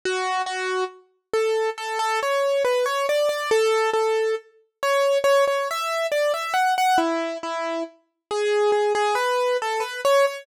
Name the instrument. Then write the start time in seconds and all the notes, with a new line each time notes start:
acoustic grand piano
0.05 F#4
0.46 F#4
1.33 A4
1.78 A4
1.99 A4
2.23 C#5
2.64 B4
2.86 C#5
3.09 D5
3.29 D5
3.51 A4
3.93 A4
4.83 C#5
5.24 C#5
5.47 C#5
5.71 E5
6.12 D5
6.34 E5
6.54 F#5
6.78 F#5
6.98 E4
7.43 E4
8.31 G#4
8.72 G#4
8.95 G#4
9.15 B4
9.62 A4
9.80 B4
10.05 C#5
10.27 C#5